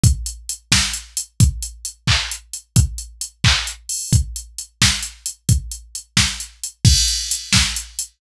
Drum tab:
CC |------|------|------|------|
HH |xxx-xx|xxx-xx|xxx-xo|xxx-xx|
CP |------|---x--|---x--|------|
SD |---o--|------|------|---o--|
BD |o--o--|o--o--|o--o--|o--o--|

CC |------|x-----|
HH |xxx-xx|-xx-xx|
CP |------|------|
SD |---o--|---o--|
BD |o--o--|o--o--|